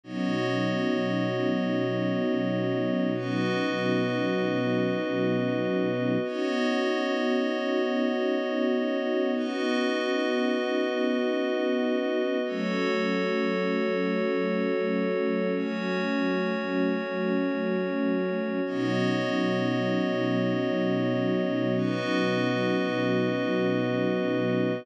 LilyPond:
<<
  \new Staff \with { instrumentName = "String Ensemble 1" } { \time 3/4 \key b \mixolydian \tempo 4 = 58 <b, fis cis' dis'>2.~ | <b, fis cis' dis'>2. | <b cis' dis' fis'>2.~ | <b cis' dis' fis'>2. |
<fis a cis'>2.~ | <fis a cis'>2. | <b, fis cis' dis'>2.~ | <b, fis cis' dis'>2. | }
  \new Staff \with { instrumentName = "Pad 5 (bowed)" } { \time 3/4 \key b \mixolydian <b fis' cis'' dis''>2. | <b fis' b' dis''>2. | <b fis' cis'' dis''>2. | <b fis' b' dis''>2. |
<fis' a' cis''>2. | <cis' fis' cis''>2. | <b fis' cis'' dis''>2. | <b fis' b' dis''>2. | }
>>